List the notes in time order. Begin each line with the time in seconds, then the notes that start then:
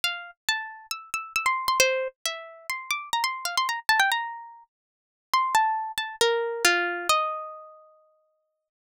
0.04 F5
0.49 A5
0.91 E6
1.14 E6
1.36 E6
1.46 C6
1.68 C6
1.80 C5
2.26 E5
2.70 C6
2.91 D6
3.13 A#5
3.24 C6
3.45 F5
3.57 C6
3.69 A#5
3.89 A5
4.00 G5
4.12 A#5
5.34 C6
5.55 A5
5.98 A5
6.21 A#4
6.65 F4
7.09 D#5